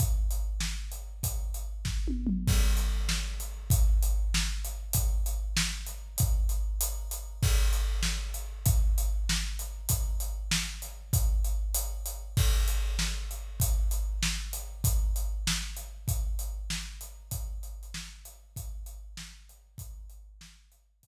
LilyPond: \new DrumStaff \drummode { \time 6/8 \tempo 4. = 97 <hh bd>8. hh8. sn8. hh8. | <hh bd>8. hh8. <bd sn>8 tommh8 toml8 | <cymc bd>8. hh8. sn8. hh8. | <hh bd>8. hh8. sn8. hh8. |
<hh bd>8. hh8. sn8. hh8. | <hh bd>8. hh8. hh8. hh8. | <cymc bd>8. hh8. sn8. hh8. | <hh bd>8. hh8. sn8. hh8. |
<hh bd>8. hh8. sn8. hh8. | <hh bd>8. hh8. hh8. hh8. | <cymc bd>8. hh8. sn8. hh8. | <hh bd>8. hh8. sn8. hh8. |
<hh bd>8. hh8. sn8. hh8. | <hh bd>8. hh8. sn8. hh8. | <hh bd>8. hh8 hh16 sn8. hh8. | <hh bd>8. hh8. sn8. hh8. |
<hh bd>8. hh8. sn8. hh8. | <hh bd>4. r4. | }